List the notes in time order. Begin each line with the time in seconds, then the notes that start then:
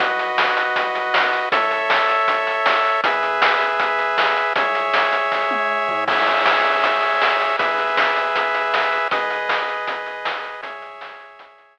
0.00 B1 F#4 B4 D#5, kick, closed hi-hat
0.19 closed hi-hat
0.38 snare
0.57 closed hi-hat
0.76 kick, closed hi-hat
0.95 closed hi-hat
1.14 snare
1.33 closed hi-hat
1.52 A1 A4 C#5 E5, kick, closed hi-hat
1.71 closed hi-hat
1.90 snare
2.09 closed hi-hat
2.28 kick, closed hi-hat
2.47 closed hi-hat
2.66 snare
2.85 closed hi-hat
3.04 E2 G#4 B4 E5, kick, closed hi-hat
3.23 closed hi-hat
3.42 snare
3.61 closed hi-hat
3.80 kick, closed hi-hat
3.99 closed hi-hat
4.18 snare
4.36 closed hi-hat
4.56 C#2 G#4 C#5 E5, kick, closed hi-hat
4.75 closed hi-hat
4.94 snare
5.13 closed hi-hat
5.32 kick, snare
5.51 high tom
5.88 floor tom
6.08 C#2 G#4 C#5 E5, kick, crash
6.27 closed hi-hat
6.46 snare
6.65 closed hi-hat
6.84 kick, closed hi-hat
7.02 closed hi-hat
7.22 snare
7.40 closed hi-hat
7.59 E2 G#4 B4 E5, kick, closed hi-hat
7.79 closed hi-hat
7.97 snare
8.16 closed hi-hat
8.36 kick, closed hi-hat
8.54 closed hi-hat
8.74 snare
8.93 closed hi-hat
9.11 G#1 G#4 B4 D#5, kick, closed hi-hat
9.30 closed hi-hat
9.49 snare
9.68 closed hi-hat
9.87 kick, closed hi-hat
10.06 closed hi-hat
10.25 snare
10.44 closed hi-hat
10.62 C#2 G#4 C#5 E5, kick, closed hi-hat
10.82 closed hi-hat
11.01 snare
11.20 closed hi-hat
11.39 kick, closed hi-hat
11.58 closed hi-hat
11.77 snare